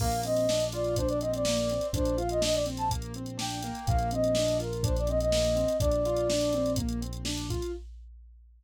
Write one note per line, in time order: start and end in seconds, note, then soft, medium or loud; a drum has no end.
0.00 1.78 A#1 loud
0.00 0.22 A#3 loud
0.00 0.21 F5 medium
0.00 kick medium
0.00 crash medium
0.12 closed hi-hat medium
0.23 0.46 C4 medium
0.23 0.65 D#5 medium
0.23 closed hi-hat medium
0.36 closed hi-hat medium
0.49 0.71 D4 medium
0.49 snare medium
0.60 closed hi-hat medium
0.72 0.95 F4 medium
0.72 0.96 D5 medium
0.72 closed hi-hat medium
0.84 closed hi-hat medium
0.96 1.20 D4 medium
0.96 1.08 C5 medium
0.96 kick medium
0.96 closed hi-hat medium
1.08 1.20 D5 medium
1.08 closed hi-hat medium
1.20 1.43 C4 medium
1.20 1.32 D#5 medium
1.20 closed hi-hat medium
1.34 1.87 D5 medium
1.34 closed hi-hat medium
1.45 1.69 A#3 medium
1.45 snare loud
1.57 closed hi-hat medium
1.70 1.93 C4 medium
1.70 closed hi-hat medium
1.81 closed hi-hat medium
1.93 3.71 A#1 loud
1.93 2.15 D4 medium
1.93 2.18 C5 medium
1.93 kick medium
1.93 closed hi-hat medium
2.05 closed hi-hat medium
2.18 2.39 F4 medium
2.18 2.30 F5 medium
2.18 closed hi-hat medium
2.29 2.42 D#5 medium
2.29 closed hi-hat medium
2.41 2.63 D4 medium
2.41 2.55 D#5 medium
2.41 snare loud
2.54 2.65 D5 medium
2.54 closed hi-hat medium
2.66 2.88 C4 medium
2.66 closed hi-hat medium
2.77 2.89 A5 medium
2.77 closed hi-hat medium
2.90 3.13 A#3 medium
2.90 kick medium
2.90 closed hi-hat medium
3.02 closed hi-hat medium
3.14 3.38 C4 medium
3.14 closed hi-hat medium
3.26 closed hi-hat medium
3.38 3.59 D4 medium
3.38 3.85 G5 medium
3.38 snare medium
3.51 closed hi-hat medium
3.63 4.10 A#3 loud
3.63 closed hi-hat medium
3.75 closed hi-hat medium
3.87 5.65 A#1 loud
3.87 4.10 F5 medium
3.87 kick medium
3.87 closed hi-hat medium
3.99 closed hi-hat medium
4.11 4.34 C4 medium
4.11 4.57 D#5 medium
4.11 closed hi-hat medium
4.24 closed hi-hat medium
4.35 4.57 D4 medium
4.35 snare loud
4.48 closed hi-hat medium
4.59 4.81 F4 medium
4.59 4.83 A#4 medium
4.59 closed hi-hat medium
4.73 closed hi-hat medium
4.83 5.06 D4 medium
4.83 4.96 C5 medium
4.83 kick medium
4.83 closed hi-hat medium
4.96 5.09 D5 medium
4.96 closed hi-hat medium
5.07 5.31 C4 medium
5.07 5.19 D#5 medium
5.07 closed hi-hat medium
5.20 5.77 D#5 medium
5.20 closed hi-hat medium
5.32 5.55 A#3 medium
5.32 snare loud
5.45 closed hi-hat medium
5.56 5.77 C4 medium
5.56 closed hi-hat medium
5.68 closed hi-hat medium
5.80 7.59 A#1 loud
5.80 6.02 D4 medium
5.80 6.72 D5 medium
5.80 kick medium
5.80 closed hi-hat medium
5.91 closed hi-hat medium
6.05 6.28 F4 medium
6.05 closed hi-hat medium
6.17 closed hi-hat medium
6.30 6.52 D4 medium
6.30 snare loud
6.41 closed hi-hat medium
6.53 6.76 C4 medium
6.53 closed hi-hat medium
6.66 closed hi-hat medium
6.76 7.00 A#3 medium
6.76 kick medium
6.76 closed hi-hat medium
6.89 closed hi-hat medium
7.01 7.23 C4 medium
7.01 closed hi-hat medium
7.13 closed hi-hat medium
7.25 7.47 D4 medium
7.25 snare medium
7.37 closed hi-hat medium
7.50 7.72 F4 medium
7.50 kick medium
7.50 closed hi-hat medium
7.62 closed hi-hat medium